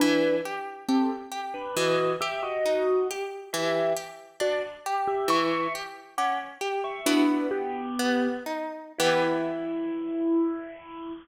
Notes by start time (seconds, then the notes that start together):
0.00 E3 D4 B4
0.45 G4
0.88 C4 G4 A4
1.32 G4
1.54 D4 B4
1.76 E3 F#4 D#5
2.21 G4 E5
2.43 F#4 D#5
2.65 D#4
3.11 G4
3.53 E3 G4 E5
3.97 G4
4.40 D4 F#4 D5
4.86 G4
5.07 G4 E5
5.28 E3 E5 C#6
5.75 G4
6.18 C#4 F#5 D6
6.61 G4
6.84 E5 C#6
7.06 B3 D4 E4 F#4 B4
7.51 B3 G4
7.99 B3
8.46 D#4
8.98 E3 B3 E4 G4